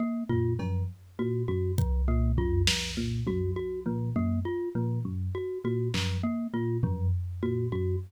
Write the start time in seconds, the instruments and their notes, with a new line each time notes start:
0.00 glockenspiel A#3
0.29 electric piano 1 A#2, glockenspiel F4, floor tom
0.59 electric piano 1 F#2, glockenspiel F3, cowbell
1.19 electric piano 1 A#2, glockenspiel F#4
1.48 electric piano 1 F#2, glockenspiel F#4
1.78 glockenspiel F3, kick
2.08 electric piano 1 A#2, glockenspiel A#3
2.37 electric piano 1 F#2, glockenspiel F4, floor tom
2.67 glockenspiel F3, snare
2.97 electric piano 1 A#2
3.27 electric piano 1 F#2, glockenspiel F#4, high tom
3.56 glockenspiel F#4
3.86 electric piano 1 A#2, glockenspiel F3
4.16 electric piano 1 F#2, glockenspiel A#3
4.45 glockenspiel F4
4.75 electric piano 1 A#2, glockenspiel F3
5.05 electric piano 1 F#2
5.35 glockenspiel F#4
5.64 electric piano 1 A#2, glockenspiel F#4
5.94 electric piano 1 F#2, glockenspiel F3, clap
6.24 glockenspiel A#3
6.53 electric piano 1 A#2, glockenspiel F4
6.83 electric piano 1 F#2, glockenspiel F3, floor tom
7.43 electric piano 1 A#2, glockenspiel F#4
7.72 electric piano 1 F#2, glockenspiel F#4